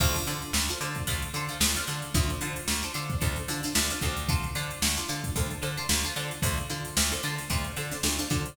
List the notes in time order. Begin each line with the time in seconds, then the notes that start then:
0.00 D2 D4 F4 A4 C5, kick, crash
0.15 closed hi-hat
0.26 D3 D4 F4 A4 C5, closed hi-hat
0.42 closed hi-hat
0.53 D2, snare
0.69 D4 F4 A4 C5, closed hi-hat
0.81 D3 D4 F4 A4 C5, closed hi-hat
0.95 kick, closed hi-hat
1.07 D2 D4 F4 A4 C5, kick, closed hi-hat
1.22 closed hi-hat
1.34 D3 D4 F4 A4 C5, closed hi-hat
1.48 D4 F4 A4 C5, snare, closed hi-hat
1.60 D2 D4 F4 A4 C5, snare
1.76 D4 F4 A4 C5, closed hi-hat
1.87 D3 D4 F4 A4 C5, closed hi-hat
2.02 closed hi-hat
2.14 D2 D4 F4 A4 C5, kick, closed hi-hat
2.30 closed hi-hat
2.41 D3 D4 F4 A4 C5, closed hi-hat
2.56 closed hi-hat
2.68 D2, snare
2.83 D4 F4 A4 C5, closed hi-hat
2.94 D3 D4 F4 A4 C5, closed hi-hat
3.10 kick, closed hi-hat
3.21 D2 D4 F4 A4 C5, kick, closed hi-hat
3.36 closed hi-hat
3.48 D3 D4 F4 A4 C5, snare, closed hi-hat
3.63 D4 F4 A4 C5, snare, closed hi-hat
3.75 D2 D4 F4 A4 C5, snare
3.90 D4 F4 A4 C5, closed hi-hat
4.01 D2 D4 F4 A4 C5, kick, closed hi-hat
4.17 closed hi-hat
4.29 D4 F4 A4 C5, kick, closed hi-hat
4.43 closed hi-hat
4.55 D3 D4 F4 A4 C5, closed hi-hat
4.71 closed hi-hat
4.82 D2, snare
4.97 D4 F4 A4 C5, snare, closed hi-hat
5.08 D3 D4 F4 A4 C5, closed hi-hat
5.24 kick, closed hi-hat
5.36 D2 D4 F4 A4 C5, kick, closed hi-hat
5.50 closed hi-hat
5.62 D3 D4 F4 A4 C5, closed hi-hat
5.77 D4 F4 A4 C5, closed hi-hat
5.89 D2 D4 F4 A4 C5, snare
6.04 D4 F4 A4 C5, snare, closed hi-hat
6.16 D3 D4 F4 A4 C5, closed hi-hat
6.31 closed hi-hat
6.42 D2 D4 F4 A4 C5, kick, closed hi-hat
6.57 closed hi-hat
6.70 D3 D4 F4 A4 C5, closed hi-hat
6.85 closed hi-hat
6.97 D2, snare
7.11 D4 F4 A4 C5, closed hi-hat
7.23 D3 D4 F4 A4 C5, closed hi-hat
7.38 snare, closed hi-hat
7.50 D2 D4 F4 A4 C5, kick, closed hi-hat
7.64 closed hi-hat
7.76 D3 D4 F4 A4 C5, closed hi-hat
7.91 D4 F4 A4 C5, snare, closed hi-hat
8.03 D2 D4 F4 A4 C5, snare
8.19 D4 F4 A4 C5, closed hi-hat
8.30 D3 D4 F4 A4 C5, kick, closed hi-hat
8.46 closed hi-hat